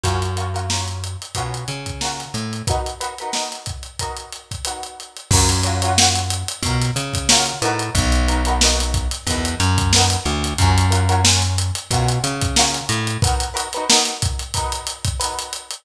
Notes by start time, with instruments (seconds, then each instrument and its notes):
0.04 electric bass (finger) F#2, pizzicato strings C#4 F4 F#4 A#4, kick, closed hi-hat
0.22 closed hi-hat
0.36 pizzicato strings C#4 F4 F#4 A#4, closed hi-hat
0.54 pizzicato strings C#4 F4 F#4 A#4, closed hi-hat
0.70 pizzicato strings C#4 F4 F#4 A#4, snare
0.88 closed hi-hat
1.04 closed hi-hat
1.22 closed hi-hat
1.35 electric bass (finger) B2, pizzicato strings F4 F#4 A#4, kick, closed hi-hat
1.39 pizzicato strings C#4
1.54 closed hi-hat
1.68 electric bass (finger) C#3, closed hi-hat
1.86 kick, closed hi-hat
2.01 pizzicato strings C#4 F4 F#4 A#4, snare
2.19 snare, closed hi-hat
2.34 electric bass (finger) A2, closed hi-hat
2.53 closed hi-hat
2.67 pizzicato strings D#4 F#4 A#4 B4, kick, closed hi-hat
2.86 closed hi-hat
3.00 pizzicato strings D#4 F#4 A#4 B4, closed hi-hat
3.18 pizzicato strings F#4 A#4 B4, closed hi-hat
3.23 pizzicato strings D#4
3.32 pizzicato strings D#4 F#4 A#4 B4, snare
3.51 snare, closed hi-hat
3.66 kick, closed hi-hat
3.83 closed hi-hat
3.99 pizzicato strings D#4 F#4 A#4 B4, kick, closed hi-hat
4.17 closed hi-hat
4.32 closed hi-hat
4.51 kick, closed hi-hat
4.65 pizzicato strings D#4 F#4 A#4 B4, closed hi-hat
4.83 closed hi-hat
5.00 closed hi-hat
5.17 closed hi-hat
5.31 electric bass (finger) F#2, pizzicato strings F#4 A#4 C#5, kick, crash
5.35 pizzicato strings F4
5.49 closed hi-hat
5.63 pizzicato strings F4 F#4 A#4 C#5, snare, closed hi-hat
5.82 pizzicato strings F4 F#4 A#4 C#5, closed hi-hat
5.97 pizzicato strings F4 F#4 A#4 C#5, snare
6.16 closed hi-hat
6.30 closed hi-hat
6.48 closed hi-hat
6.63 electric bass (finger) B2, pizzicato strings A#4 C#5, kick, closed hi-hat
6.67 pizzicato strings F4 F#4
6.81 snare, closed hi-hat
6.96 electric bass (finger) C#3, closed hi-hat
7.13 kick, snare, closed hi-hat
7.29 pizzicato strings F4 F#4 A#4 C#5, snare
7.46 closed hi-hat
7.62 electric bass (finger) A2, pizzicato strings D#4 F#4 A#4 B4, closed hi-hat
7.79 closed hi-hat
7.95 electric bass (finger) B1, kick, closed hi-hat
8.12 closed hi-hat
8.28 pizzicato strings D#4 F#4 A#4 B4, closed hi-hat
8.45 pizzicato strings D#4 F#4 A#4 B4, closed hi-hat
8.61 pizzicato strings D#4 F#4 A#4 B4, snare
8.80 closed hi-hat
8.94 kick, closed hi-hat
9.11 snare, closed hi-hat
9.27 electric bass (finger) E2, pizzicato strings D#4 F#4 A#4 B4, kick, closed hi-hat
9.45 closed hi-hat
9.60 electric bass (finger) F#2, closed hi-hat
9.78 kick, closed hi-hat
9.93 pizzicato strings F#4 A#4 B4, snare
9.97 pizzicato strings D#4
10.10 snare, closed hi-hat
10.25 electric bass (finger) D2, closed hi-hat
10.44 closed hi-hat
10.58 electric bass (finger) F#2, pizzicato strings C#4 F4 F#4 A#4, kick, closed hi-hat
10.78 closed hi-hat
10.91 pizzicato strings C#4 F4 F#4 A#4, closed hi-hat
11.09 pizzicato strings C#4 F4 F#4 A#4, closed hi-hat
11.24 pizzicato strings C#4 F4 F#4 A#4, snare
11.42 closed hi-hat
11.58 closed hi-hat
11.75 closed hi-hat
11.91 electric bass (finger) B2, pizzicato strings F4 F#4 A#4, kick, closed hi-hat
11.95 pizzicato strings C#4
12.09 closed hi-hat
12.24 electric bass (finger) C#3, closed hi-hat
12.41 kick, closed hi-hat
12.56 pizzicato strings C#4 F4 F#4 A#4, snare
12.74 snare, closed hi-hat
12.89 electric bass (finger) A2, closed hi-hat
13.07 closed hi-hat
13.22 pizzicato strings D#4 F#4 A#4 B4, kick, closed hi-hat
13.40 closed hi-hat
13.54 pizzicato strings D#4 F#4 A#4 B4, closed hi-hat
13.73 pizzicato strings F#4 A#4 B4, closed hi-hat
13.77 pizzicato strings D#4
13.89 pizzicato strings D#4 F#4 A#4 B4, snare
14.05 snare, closed hi-hat
14.22 kick, closed hi-hat
14.39 closed hi-hat
14.54 pizzicato strings D#4 F#4 A#4 B4, kick, closed hi-hat
14.72 closed hi-hat
14.87 closed hi-hat
15.05 kick, closed hi-hat
15.20 pizzicato strings D#4 F#4 A#4 B4, closed hi-hat
15.39 closed hi-hat
15.53 closed hi-hat
15.71 closed hi-hat